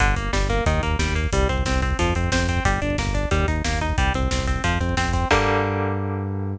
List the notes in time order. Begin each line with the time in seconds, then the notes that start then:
0.00 G1 D3, kick, closed hi-hat
0.08 kick
0.16 G1 A#3, kick, closed hi-hat
0.33 G1 G3, kick, snare
0.41 kick
0.50 A#3, kick, closed hi-hat
0.58 kick
0.66 D#2 D#3, kick, closed hi-hat
0.74 kick
0.83 D#2 A#3, kick, closed hi-hat
0.91 kick
0.99 D#2 G3, kick, snare
1.08 kick
1.15 A#3, kick, closed hi-hat
1.24 kick
1.33 C2 G3, kick, closed hi-hat
1.41 kick
1.49 C2 C4, kick, closed hi-hat
1.58 kick
1.65 C2 C4, kick, snare
1.74 kick
1.82 C4, kick, closed hi-hat
1.91 kick
1.99 F2 F3, kick, closed hi-hat
2.07 kick
2.15 F2 C4, kick, closed hi-hat
2.24 kick
2.32 F2 C4, kick, snare
2.40 kick
2.49 C4, kick, closed hi-hat
2.57 kick
2.65 G1 G3, kick, closed hi-hat
2.74 kick
2.82 G1 D4, kick, closed hi-hat
2.90 kick
2.98 G1 A#3, kick, snare
3.07 kick
3.14 D4, kick, closed hi-hat
3.23 kick
3.31 D#2 G3, kick, closed hi-hat
3.40 kick
3.48 D#2 D#4, kick, closed hi-hat
3.56 kick
3.64 D#2 A#3, kick, snare
3.73 kick
3.81 D#4, kick, closed hi-hat
3.90 kick
3.98 C2 G3, kick, closed hi-hat
4.06 kick
4.14 C2 C4, kick, closed hi-hat
4.23 kick
4.31 C2 C4, kick, snare
4.39 kick
4.47 C4, kick, closed hi-hat
4.56 kick
4.64 F2 F3, kick, closed hi-hat
4.73 kick
4.80 F2 C4, kick, closed hi-hat
4.89 kick
4.97 F2 C4, kick, snare
5.05 kick
5.13 C4, kick, closed hi-hat
5.22 kick
5.31 G2 D3 G3 A#3, kick, crash